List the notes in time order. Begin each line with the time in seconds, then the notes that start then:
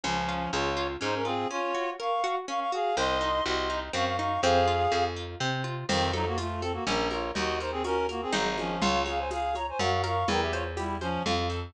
0.04 C#2 F3 C#4
0.29 F4
0.53 C#2 F4 G#4 C#5
0.77 F4
1.01 G#2 C#4 D#4 C5
1.15 C#4 A#4
1.25 C4 F4 G#4
1.50 C#4 F4 C#5
1.75 F#4
2.00 A#4 F5 C#6
2.24 F#4
2.48 C#4 F5 C#6
2.60 F5 C#6
2.72 F#4 G#4 F5
2.97 C2 C4 D#5 C6
3.21 D#4
3.46 C2 F#4 D#5 C6
3.70 D#4
3.93 F#2 C4 F5 C#6
4.06 F5 C#6
4.17 D#4 F5 C#6
4.42 F2 C4 G#4 F5
4.68 F4
4.92 F2 G#4
5.16 F4
5.40 C3 C4
5.64 F4
5.89 F2 D#3 C4, crash, low conga, shaker
6.13 F#3 D#4 A4, high conga, shaker
6.26 A#3 F#4
6.38 A3 F4, tambourine, high conga, shaker
6.61 C4 A4, high conga, shaker
6.73 A#3 F#4
6.87 A#1 C#4 A#4, low conga, shaker
7.11 F4 A#4 C#5, high conga, shaker
7.35 D#2 D#4 F#4 D#5, low conga, shaker
7.60 D#4 A#4 C5, shaker
7.71 C4 G#4
7.84 C#4 F#4 A#4, tambourine, high conga, shaker
8.09 A#3 F#4 A#4, high conga, shaker
8.22 C4 G#4
8.33 G#1 F#3 D#4 G#4 C5, low conga, shaker
8.58 F3 C#4, high conga, shaker
8.81 C#2 F4 C#5, low conga, shaker
9.06 G#4 C#5 F5, high conga, shaker
9.18 C5 G#5
9.31 G#4 F5, tambourine, high conga, shaker
9.55 C#5 A#5, high conga, shaker
9.69 C5 G#5
9.79 F#2 F#4 F5 C#6, low conga, shaker
10.04 A#4 F5 C#6, high conga, shaker
10.28 E2 E4 A#4 G5, low conga, shaker
10.41 G4 E5
10.52 F4 C5 C#5, high conga, shaker
10.77 G3 E4 G4, tambourine, high conga, shaker
11.01 F3 C#4 C5, high conga, shaker
11.26 F2 F4, low conga, shaker
11.50 A4, shaker